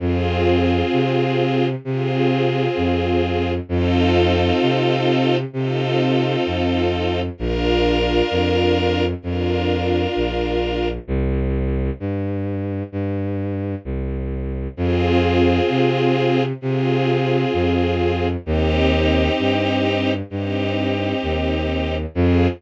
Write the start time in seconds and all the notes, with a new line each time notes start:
0.00 F2 C4 F4 G#4
0.92 C3
1.85 C3 C4 F4 G#4
2.77 F2
3.69 F2 C4 D#4 F4 A4
4.62 C3
5.53 C3 C4 D#4 F4 A4
6.46 F2
7.38 A#1 D4 F4 A#4
8.31 F2
9.22 F2 D4 F4 A#4
10.16 A#1
11.08 C2
12.00 G2
12.92 G2
13.85 C2
14.77 F2 C4 F4 G#4
15.69 C3
16.61 C3 C4 F4 G#4
17.53 F2
18.45 D#2 C4 D#4 G4
19.39 G2
20.30 G2 C4 D#4 G4
21.23 D#2
22.14 F2 C4 F4 G#4